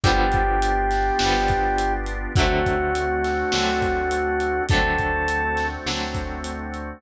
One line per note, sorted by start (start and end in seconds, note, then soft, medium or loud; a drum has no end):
0.04 1.11 G1 loud
0.04 1.09 D3 loud
0.04 1.09 F3 loud
0.04 1.09 G3 loud
0.04 2.33 B3 medium
0.04 1.09 B3 loud
0.04 2.33 D4 medium
0.04 2.33 F4 medium
0.04 1.93 G4 loud
0.04 2.33 G4 medium
0.04 kick loud
0.04 closed hi-hat loud
0.32 kick loud
0.32 closed hi-hat medium
0.62 closed hi-hat loud
0.91 snare medium
0.91 closed hi-hat medium
1.19 2.27 G1 loud
1.19 2.25 D3 medium
1.19 2.25 F3 medium
1.19 2.25 G3 medium
1.19 snare loud
1.24 2.25 B3 medium
1.48 kick loud
1.48 closed hi-hat medium
1.78 closed hi-hat loud
2.06 closed hi-hat medium
2.36 3.44 D2 loud
2.36 3.42 D3 loud
2.36 3.42 F#3 loud
2.36 4.66 A3 medium
2.36 3.42 A3 loud
2.36 4.66 C4 medium
2.36 4.66 D4 medium
2.36 4.63 F#4 medium
2.36 4.66 F#4 medium
2.36 kick loud
2.36 closed hi-hat loud
2.40 3.42 C4 loud
2.66 kick medium
2.66 closed hi-hat medium
2.95 closed hi-hat loud
3.24 snare medium
3.24 closed hi-hat medium
3.52 4.61 D2 loud
3.52 4.58 D3 medium
3.52 4.58 F#3 loud
3.52 4.58 A3 medium
3.52 snare loud
3.57 4.58 C4 loud
3.82 kick medium
3.82 closed hi-hat medium
4.11 closed hi-hat loud
4.40 closed hi-hat medium
4.69 5.77 D2 loud
4.69 5.75 D3 medium
4.69 5.75 F#3 loud
4.69 6.99 A3 medium
4.69 5.75 A3 medium
4.69 6.99 C4 medium
4.69 6.99 D4 medium
4.69 6.99 F#4 medium
4.69 5.67 A4 loud
4.69 kick loud
4.69 closed hi-hat loud
4.73 5.75 C4 loud
4.98 kick medium
4.98 closed hi-hat medium
5.28 closed hi-hat loud
5.57 snare medium
5.57 closed hi-hat medium
5.86 6.93 D2 medium
5.86 6.91 D3 medium
5.86 6.91 F#3 medium
5.86 6.91 A3 medium
5.86 6.91 C4 medium
5.86 snare loud
6.15 kick medium
6.15 closed hi-hat medium
6.44 closed hi-hat loud
6.74 closed hi-hat medium